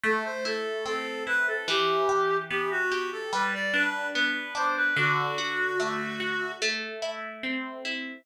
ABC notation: X:1
M:4/4
L:1/16
Q:1/4=73
K:Em
V:1 name="Clarinet"
A c A2 A2 B A | G4 G F2 A B d B2 B2 c B | F8 z8 |]
V:2 name="Acoustic Guitar (steel)"
A,2 E2 C2 E2 | E,2 G2 B,2 G2 G,2 D2 B,2 D2 | D,2 F2 A,2 F2 A,2 E2 C2 E2 |]